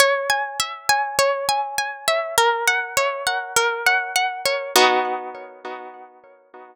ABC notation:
X:1
M:4/4
L:1/8
Q:1/4=101
K:B
V:1 name="Harpsichord"
c g e g c g g e | A f c f A f f c | [B,DF]8 |]